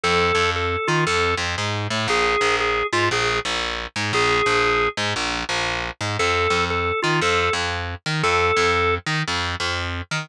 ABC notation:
X:1
M:4/4
L:1/8
Q:"Swing" 1/4=117
K:F
V:1 name="Drawbar Organ"
A2 A F A z3 | _A2 A F A z3 | _A3 z5 | A2 A F A z3 |
A3 z5 |]
V:2 name="Electric Bass (finger)" clef=bass
F,, F,,2 _E, F,, F,, _A,, =A,, | B,,, B,,,2 _A,, B,,, B,,,2 A,, | B,,, B,,,2 _A,, B,,, B,,,2 A,, | F,, F,,2 _E, F,, F,,2 E, |
F,, F,,2 _E, F,, F,,2 E, |]